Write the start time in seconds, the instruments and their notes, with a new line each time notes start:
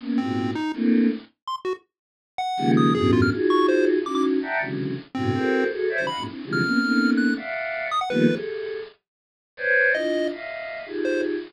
0.00 choir aahs A#3 B3 C#4
0.18 choir aahs G#2 A#2 B2, lead 1 (square) C4
0.55 lead 1 (square) D#4
0.74 choir aahs A3 A#3 C4 D4 E4
1.47 lead 1 (square) C6
1.65 lead 1 (square) F#4
2.38 lead 1 (square) F#5
2.57 choir aahs C#3 D#3 F3 G3 G#3 A#3
2.77 lead 1 (square) D#6
2.94 choir aahs E2 F#2 G2 A2 B2, lead 1 (square) G#4
3.13 lead 1 (square) F4
3.22 lead 1 (square) F6
3.31 choir aahs D#4 F4 F#4 G#4
3.50 lead 1 (square) C#6
3.68 lead 1 (square) C5
4.05 choir aahs C#4 D#4 E4 F#4, lead 1 (square) D6
4.15 lead 1 (square) D6
4.42 choir aahs D5 E5 F#5 G5 A5 A#5
4.60 choir aahs C3 C#3 D3 E3 F#3 G#3
5.15 choir aahs G2 A2 B2 C3, lead 1 (square) C4
5.34 choir aahs E4 F#4 G#4 A4 A#4 C5
5.70 choir aahs F#4 G#4 A4
5.89 choir aahs C5 C#5 D5 E5
5.98 choir aahs C#3 D#3 E3 F#3 G3, lead 1 (square) C5
6.07 choir aahs D#5 F5 F#5, lead 1 (square) B5
6.17 choir aahs F2 F#2 G#2 A#2
6.26 choir aahs C4 D4 E4
6.44 choir aahs C3 D3 E3 F3 G3 G#3
6.53 lead 1 (square) F6
6.62 choir aahs A#3 B3 C4 C#4
6.81 choir aahs A3 A#3 B3 C4 C#4 D#4
7.17 lead 1 (square) F#6
7.36 choir aahs D5 E5 F5 F#5
7.91 lead 1 (square) D#6
8.01 lead 1 (square) F#5
8.10 choir aahs D#3 F3 G3 A3 A#3 B3, lead 1 (square) B4
8.28 choir aahs G4 G#4 A4
9.57 choir aahs B4 C5 C#5 D5
9.94 choir aahs D4 E4 F4, lead 1 (square) D#5
10.31 choir aahs D#5 E5 F5
10.86 choir aahs D#4 F4 G4 G#4
11.05 lead 1 (square) C5